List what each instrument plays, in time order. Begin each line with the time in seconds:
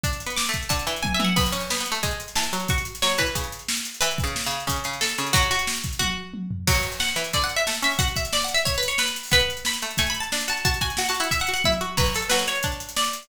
0.03 pizzicato strings D4, kick, closed hi-hat
0.13 closed hi-hat
0.20 closed hi-hat
0.26 pizzicato strings B3, closed hi-hat
0.36 pizzicato strings D6, snare
0.46 pizzicato strings A3, closed hi-hat
0.54 kick, closed hi-hat
0.63 closed hi-hat
0.69 pizzicato strings D3 A5, kick, closed hi-hat
0.79 closed hi-hat
0.87 pizzicato strings E3, closed hi-hat
0.96 closed hi-hat
1.03 pizzicato strings G#5, kick, high tom
1.14 pizzicato strings E5
1.20 pizzicato strings E3, high tom
1.24 pizzicato strings F#5
1.36 pizzicato strings B3 B5, kick, crash
1.46 closed hi-hat
1.52 pizzicato strings C#4, closed hi-hat
1.60 closed hi-hat
1.70 pizzicato strings B3, snare
1.78 pizzicato strings B3, closed hi-hat
1.86 closed hi-hat
1.92 pizzicato strings A3, closed hi-hat
2.03 pizzicato strings G#3, kick, closed hi-hat
2.11 closed hi-hat
2.20 closed hi-hat
2.28 closed hi-hat
2.35 pizzicato strings E3 A5, snare
2.43 closed hi-hat
2.53 pizzicato strings F#3, closed hi-hat
2.60 closed hi-hat
2.68 pizzicato strings F#4 C#6, kick, closed hi-hat
2.78 closed hi-hat
2.85 closed hi-hat
2.95 closed hi-hat
3.02 pizzicato strings F#3 C#5, snare
3.10 closed hi-hat
3.18 pizzicato strings E3 B4, kick, closed hi-hat
3.26 closed hi-hat
3.35 pizzicato strings C#3, kick, closed hi-hat
3.44 closed hi-hat
3.52 closed hi-hat
3.59 closed hi-hat
3.68 snare
3.77 closed hi-hat
3.85 closed hi-hat
3.94 closed hi-hat
4.01 pizzicato strings E3 B4, closed hi-hat
4.11 closed hi-hat
4.18 kick, closed hi-hat
4.24 pizzicato strings C#3, closed hi-hat
4.36 snare
4.44 pizzicato strings C#3, closed hi-hat
4.51 closed hi-hat
4.60 closed hi-hat
4.67 pizzicato strings C#3, kick, closed hi-hat
4.76 closed hi-hat
4.84 pizzicato strings C#3, closed hi-hat
4.93 closed hi-hat
5.01 pizzicato strings A4, snare
5.09 closed hi-hat
5.18 pizzicato strings C#3, closed hi-hat
5.27 closed hi-hat
5.33 pizzicato strings F#3 F#4, kick, closed hi-hat
5.42 closed hi-hat
5.51 pizzicato strings F#4, closed hi-hat
5.59 closed hi-hat
5.67 snare
5.76 closed hi-hat
5.84 kick, closed hi-hat
5.93 closed hi-hat
5.99 pizzicato strings F#4, kick, high tom
6.34 high tom
6.51 floor tom
6.67 pizzicato strings F#3 F#4, kick, crash
6.75 closed hi-hat
6.83 closed hi-hat
6.92 closed hi-hat
7.00 pizzicato strings F#5, snare
7.08 closed hi-hat
7.16 pizzicato strings E3, closed hi-hat
7.24 closed hi-hat
7.33 pizzicato strings D3 D5, kick, closed hi-hat
7.41 pizzicato strings F#5, closed hi-hat
7.49 closed hi-hat
7.56 pizzicato strings E5, closed hi-hat
7.67 pizzicato strings A3, snare
7.74 closed hi-hat
7.82 pizzicato strings C#4 E5, closed hi-hat
7.91 open hi-hat
7.99 pizzicato strings F#4 F#5, kick, closed hi-hat
8.08 closed hi-hat
8.16 pizzicato strings E5, kick, closed hi-hat
8.25 closed hi-hat
8.33 pizzicato strings D5, snare
8.42 pizzicato strings F#5, closed hi-hat
8.48 closed hi-hat
8.54 pizzicato strings E5, closed hi-hat
8.65 pizzicato strings C#5, kick, closed hi-hat
8.74 pizzicato strings B4, closed hi-hat
8.83 closed hi-hat
8.88 pizzicato strings C#5, closed hi-hat
8.98 pizzicato strings B4, snare
9.07 closed hi-hat
9.16 closed hi-hat
9.23 open hi-hat
9.31 pizzicato strings B3 B4, kick, closed hi-hat
9.39 closed hi-hat
9.50 closed hi-hat
9.57 closed hi-hat
9.65 pizzicato strings B5, snare
9.73 closed hi-hat
9.82 pizzicato strings A3, closed hi-hat
9.91 closed hi-hat
9.97 pizzicato strings A3 G#5, kick, closed hi-hat
10.07 pizzicato strings B5, closed hi-hat
10.14 closed hi-hat
10.20 pizzicato strings A5, closed hi-hat
10.32 pizzicato strings D4, snare
10.41 closed hi-hat
10.48 pizzicato strings F#4 A5, closed hi-hat
10.57 closed hi-hat
10.65 pizzicato strings F#4 A5, kick, closed hi-hat
10.74 closed hi-hat
10.81 pizzicato strings F#4 G#5, kick, closed hi-hat
10.90 closed hi-hat
10.97 pizzicato strings F#4 F#5, snare
11.05 pizzicato strings A5, closed hi-hat
11.10 pizzicato strings F#4
11.14 closed hi-hat
11.20 pizzicato strings E4 F#5, closed hi-hat
11.31 pizzicato strings E5, kick, closed hi-hat
11.40 pizzicato strings F#5, closed hi-hat
11.47 pizzicato strings F#4, closed hi-hat
11.54 pizzicato strings F#5, closed hi-hat
11.64 pizzicato strings E4 E5, kick, high tom
11.72 closed hi-hat
11.81 pizzicato strings F#4
11.97 pizzicato strings F#3 B4, kick, crash
12.06 closed hi-hat
12.14 pizzicato strings A4, closed hi-hat
12.22 closed hi-hat
12.29 pizzicato strings F#3 B4, snare
12.39 closed hi-hat
12.47 pizzicato strings C#5, closed hi-hat
12.55 closed hi-hat
12.63 pizzicato strings D4, kick, closed hi-hat
12.72 closed hi-hat
12.80 closed hi-hat
12.89 closed hi-hat
12.96 pizzicato strings D5, snare
13.04 closed hi-hat
13.13 closed hi-hat
13.23 closed hi-hat